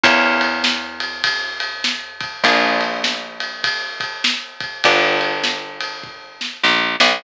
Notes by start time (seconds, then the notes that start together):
0.04 E2 A#3 C#4 E4 G4, kick, ride
0.41 ride
0.64 snare
1.00 ride
1.24 kick, ride
1.60 ride
1.84 snare
2.21 kick, ride
2.44 A#1 A#3 D4 F4 G#4, kick, ride
2.81 ride
3.04 snare
3.40 ride
3.64 kick, ride
4.00 kick, ride
4.24 snare
4.60 kick, ride
4.84 G1 B3 D4 F4 G4, kick, ride
5.21 ride
5.44 snare
5.80 ride
6.04 kick
6.41 snare
6.63 A#1, snare
7.00 B1, snare